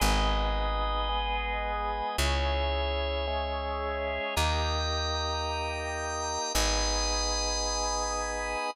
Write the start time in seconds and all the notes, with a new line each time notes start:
0.00 G#1 B3 D#4 G#4 B4 D#5
1.09 G#3 B3 G#4
2.18 C#2 C#4 E4 G#4 C#5 E5
3.27 G#3 C#4 G#4
4.36 D#2 A#3 D#4 G4 G5 A#5 D#6
6.54 G#1 B3 D#4 G#4 G#5 B5 D#6